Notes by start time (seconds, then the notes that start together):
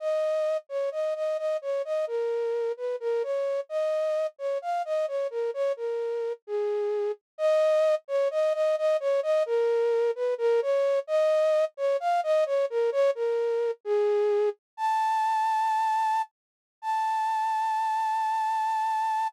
0.00 D#5
0.69 C#5
0.92 D#5
1.15 D#5
1.38 D#5
1.62 C#5
1.85 D#5
2.07 A#4
2.77 B4
3.00 A#4
3.23 C#5
3.69 D#5
4.38 C#5
4.62 F5
4.85 D#5
5.08 C#5
5.30 A#4
5.54 C#5
5.77 A#4
6.47 G#4
7.38 D#5
8.08 C#5
8.31 D#5
8.53 D#5
8.78 D#5
9.00 C#5
9.23 D#5
9.46 A#4
10.15 B4
10.38 A#4
10.62 C#5
11.07 D#5
11.77 C#5
12.00 F5
12.23 D#5
12.46 C#5
12.70 A#4
12.92 C#5
13.15 A#4
13.85 G#4
14.77 A5
16.82 A5